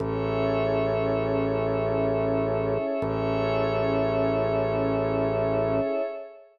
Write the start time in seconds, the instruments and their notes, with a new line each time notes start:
0.00 drawbar organ A1, pad 2 (warm) C#4 E4 G#4 A4, pad 5 (bowed) G#4 A4 C#5 E5
3.02 drawbar organ A1, pad 2 (warm) C#4 E4 G#4 A4, pad 5 (bowed) G#4 A4 C#5 E5